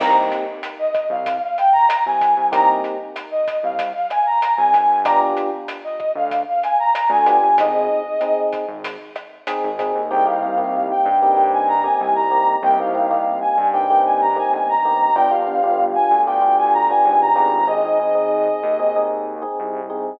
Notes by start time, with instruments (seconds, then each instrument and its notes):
0.00 synth bass 1 C2, electric piano 1 A#3 C4 D#4 G4, brass section A#5, kick, cross-stick, crash
0.32 closed hi-hat
0.63 closed hi-hat
0.79 brass section D#5
0.94 kick, cross-stick, closed hi-hat
1.10 synth bass 1 C2, brass section F5
1.26 kick, closed hi-hat
1.42 brass section F5
1.58 brass section G5, closed hi-hat
1.73 brass section A#5
1.89 brass section A#5, cross-stick, closed hi-hat
2.06 synth bass 1 C2, brass section G#5
2.21 kick, closed hi-hat
2.37 synth bass 1 C2
2.52 synth bass 1 C2, electric piano 1 A#3 C4 D#4 G4, brass section A#5, kick, closed hi-hat
2.84 closed hi-hat
3.16 cross-stick, closed hi-hat
3.31 brass section D#5
3.48 kick, closed hi-hat
3.63 synth bass 1 C2, brass section F5
3.79 kick, closed hi-hat
3.95 brass section F5
4.10 brass section G#5, cross-stick, closed hi-hat
4.26 brass section A#5
4.42 brass section A#5, closed hi-hat
4.57 synth bass 1 C2, brass section G#5
4.73 synth bass 1 G1, kick, closed hi-hat
5.05 electric piano 1 B3 D4 F4 G4, brass section A#5, kick, cross-stick, closed hi-hat
5.37 closed hi-hat
5.68 closed hi-hat
5.84 brass section D#5
6.00 kick, cross-stick
6.15 synth bass 1 D2, brass section F5
6.31 kick, closed hi-hat
6.49 brass section F5
6.63 brass section G#5, closed hi-hat
6.79 brass section A#5
6.93 brass section A#5, cross-stick, closed hi-hat
7.09 synth bass 1 D2, brass section G#5
7.26 electric piano 1 B3 D4 F4 G4, kick, closed hi-hat
7.43 synth bass 1 G1
7.58 synth bass 1 G#1, electric piano 1 C4 D#4 G#4, brass section D#5, kick, closed hi-hat
8.21 electric piano 1 C4 D#4 G#4, cross-stick, closed hi-hat
8.53 kick, closed hi-hat
8.68 synth bass 1 G#1
8.84 kick, closed hi-hat
9.16 cross-stick, closed hi-hat
9.47 electric piano 1 C4 D#4 G#4, closed hi-hat
9.63 synth bass 1 G#1
9.79 electric piano 1 C4 D#4 G#4, kick, closed hi-hat
9.95 synth bass 1 D#2
10.10 synth bass 1 C2, electric piano 1 A#3 C4 D#4 G4, brass section G5
10.26 electric piano 1 A#3 C4 D#4 G4, brass section F5
10.43 electric piano 1 A#3 C4 D#4 G4
10.58 electric piano 1 A#3 C4 D#4 G4
10.91 brass section G5
11.05 synth bass 1 G2
11.20 electric piano 1 A#3 C4 D#4 G4, brass section G5
11.36 electric piano 1 A#3 C4 D#4 G4
11.53 brass section G#5
11.68 brass section A#5
11.84 electric piano 1 A#3 C4 D#4 G4, brass section G#5
12.00 synth bass 1 C2, brass section G#5
12.15 brass section A#5
12.31 electric piano 1 A#3 C4 D#4 G4
12.62 synth bass 1 C2, electric piano 1 A#3 C4 D#4 G4, brass section G5
12.79 electric piano 1 A#3 C4 D#4 G4, brass section F5
12.94 electric piano 1 A#3 C4 D#4 G4
13.11 electric piano 1 A#3 C4 D#4 G4
13.41 brass section G#5
13.58 synth bass 1 G2
13.73 electric piano 1 A#3 C4 D#4 G4, brass section G5
13.90 electric piano 1 A#3 C4 D#4 G4
14.05 brass section G#5
14.21 brass section A#5
14.36 electric piano 1 A#3 C4 D#4 G4, brass section G#5
14.52 synth bass 1 G1, brass section G#5
14.69 brass section A#5
14.85 electric piano 1 A#3 C4 D#4 G4
15.15 synth bass 1 G1, electric piano 1 B3 D4 F4 G4, brass section G5
15.31 electric piano 1 B3 D4 F4 G4, brass section F5
15.47 electric piano 1 B3 D4 F4 G4
15.63 electric piano 1 B3 D4 F4 G4
15.95 brass section G#5
16.11 synth bass 1 D2
16.26 electric piano 1 B3 D4 F4 G4, brass section G5
16.41 electric piano 1 B3 D4 F4 G4
16.58 brass section G#5
16.73 brass section A#5
16.90 electric piano 1 B3 D4 F4 G4, brass section G#5
17.05 synth bass 1 G#1, brass section G#5
17.21 brass section A#5
17.35 synth bass 1 G#1, electric piano 1 B3 D4 F4 G4
17.68 electric piano 1 C4 D#4 G#4, brass section D#5
17.85 electric piano 1 C4 D#4 G#4
18.00 electric piano 1 C4 D#4 G#4
18.15 electric piano 1 C4 D#4 G#4
18.63 synth bass 1 D#2
18.79 electric piano 1 C4 D#4 G#4
18.96 electric piano 1 C4 D#4 G#4
19.42 electric piano 1 C4 D#4 G#4
19.59 synth bass 1 C2
19.90 electric piano 1 C4 D#4 G#4